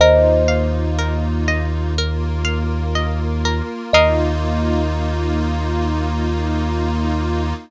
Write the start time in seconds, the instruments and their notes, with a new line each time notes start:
0.00 synth bass 2 D#2, pad 5 (bowed) A#3 D#4 F4, pizzicato strings A#4, kalimba C5 D#5
0.48 pizzicato strings F5
0.99 pizzicato strings A#4
1.48 pizzicato strings D#5
1.96 pad 5 (bowed) A#3 F4 A#4, pizzicato strings A#4
2.45 pizzicato strings F5
2.95 pizzicato strings D#5
3.45 pizzicato strings A#4
3.93 synth bass 2 D#2, pad 5 (bowed) A#3 D#4 F4, pizzicato strings A#4 D#5 F5, kalimba D#5